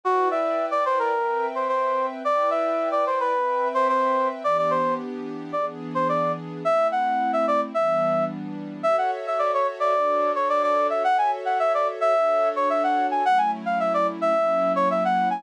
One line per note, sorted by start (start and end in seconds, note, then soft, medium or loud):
0.04 1.13 E4 medium
0.04 0.28 F#4 medium
0.04 1.13 B4 medium
0.04 1.13 D5 medium
0.04 1.13 G5 medium
0.31 0.66 E5 medium
0.71 0.84 D5 medium
0.86 0.99 C5 medium
0.99 1.46 A#4 medium
1.14 2.23 C4 medium
1.14 2.23 B4 medium
1.14 2.23 E5 medium
1.14 2.23 G5 medium
1.55 1.68 C5 medium
1.68 2.06 C5 medium
2.24 3.33 E4 medium
2.24 3.33 B4 medium
2.24 3.33 D5 medium
2.24 2.50 D5 medium
2.24 3.33 G5 medium
2.51 2.89 E5 medium
2.92 3.05 D5 medium
3.07 3.20 C5 medium
3.20 3.68 B4 medium
3.34 4.43 C4 medium
3.34 4.43 B4 medium
3.34 4.43 E5 medium
3.34 4.43 G5 medium
3.74 3.88 C5 medium
3.89 4.28 C5 medium
4.44 5.53 E3 medium
4.44 5.53 B3 loud
4.44 5.53 D4 medium
4.44 5.53 G4 medium
4.44 4.57 D5 medium
4.58 4.71 D5 medium
4.71 4.94 C5 medium
5.53 6.63 E3 medium
5.53 6.63 B3 medium
5.53 6.63 D4 medium
5.53 6.63 G#4 medium
5.53 5.66 D5 medium
5.95 6.08 C5 medium
6.09 6.32 D5 medium
6.64 7.73 A3 medium
6.64 7.73 C4 medium
6.64 7.73 E4 medium
6.64 6.87 E5 medium
6.92 7.31 F#5 medium
7.33 7.46 E5 medium
7.48 7.61 D5 medium
7.74 8.83 E3 medium
7.74 8.83 G3 medium
7.74 8.83 B3 medium
7.74 8.83 D4 medium
7.74 8.25 E5 medium
8.83 9.93 F#4 loud
8.83 9.93 A4 medium
8.83 9.93 C#5 loud
8.83 8.96 E5 medium
8.83 9.93 E5 medium
8.98 9.11 F#5 medium
9.27 9.40 E5 medium
9.39 9.52 D5 medium
9.54 9.67 C#5 medium
9.80 10.32 D5 medium
9.94 11.04 D4 loud
9.94 11.04 F#4 medium
9.94 11.04 A4 medium
9.94 11.04 C#5 medium
10.35 10.48 C#5 medium
10.49 10.63 D5 medium
10.63 10.87 D5 medium
10.90 11.03 E5 medium
11.04 12.14 F#4 medium
11.04 12.14 A4 medium
11.04 12.14 C#5 medium
11.04 12.14 E5 medium
11.04 11.17 F#5 medium
11.18 11.31 G#5 medium
11.45 11.58 F#5 medium
11.60 11.73 E5 medium
11.74 11.87 D5 medium
12.01 12.49 E5 medium
12.15 13.24 D4 loud
12.15 13.24 F#4 medium
12.15 13.24 A4 medium
12.15 13.24 C#5 medium
12.56 12.69 C#5 medium
12.70 12.83 E5 medium
12.83 13.07 F#5 medium
13.11 13.24 G#5 medium
13.25 14.34 F#3 medium
13.25 14.34 A3 medium
13.25 14.34 C#4 medium
13.25 14.34 E4 medium
13.25 13.38 F#5 medium
13.38 13.51 G#5 medium
13.66 13.79 F5 medium
13.80 13.93 E5 medium
13.94 14.07 D5 medium
14.21 14.73 E5 medium
14.35 15.43 F#3 loud
14.35 15.43 A#3 medium
14.35 15.43 C#4 medium
14.35 15.43 E4 medium
14.76 14.89 C#5 medium
14.91 15.04 E5 medium
15.05 15.29 F#5 medium
15.30 15.43 G#5 medium